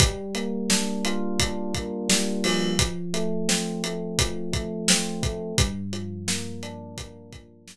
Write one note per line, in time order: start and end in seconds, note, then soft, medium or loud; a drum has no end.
0.00 2.09 G3 medium
0.00 kick loud
0.00 closed hi-hat loud
0.35 1.75 A#3 medium
0.35 closed hi-hat medium
0.70 1.39 D4 medium
0.70 snare loud
1.05 2.72 F4 medium
1.05 closed hi-hat medium
1.39 2.73 D4 medium
1.39 kick medium
1.39 closed hi-hat loud
1.75 2.75 A#3 medium
1.75 kick medium
1.75 closed hi-hat medium
2.09 2.76 G3 medium
2.09 snare loud
2.44 4.19 F3 medium
2.44 open hi-hat medium
2.79 kick medium
2.79 closed hi-hat loud
3.14 3.83 A3 medium
3.14 closed hi-hat medium
3.49 4.89 C4 medium
3.49 snare loud
3.84 4.52 A3 medium
3.84 closed hi-hat medium
4.19 5.52 F3 medium
4.19 kick medium
4.19 closed hi-hat loud
4.53 5.22 A3 medium
4.53 kick medium
4.53 closed hi-hat medium
4.88 5.56 C4 medium
4.88 snare loud
5.23 5.56 A3 medium
5.23 kick medium
5.23 closed hi-hat medium
5.58 7.67 G2 medium
5.58 kick loud
5.58 closed hi-hat loud
5.93 7.32 F3 medium
5.93 closed hi-hat medium
6.28 6.97 A#3 medium
6.28 snare loud
6.63 7.76 D4 medium
6.63 closed hi-hat medium
6.98 7.76 A#3 medium
6.98 kick medium
6.98 closed hi-hat loud
7.32 7.76 F3 medium
7.32 kick medium
7.32 closed hi-hat medium
7.68 7.76 G2 medium
7.68 snare loud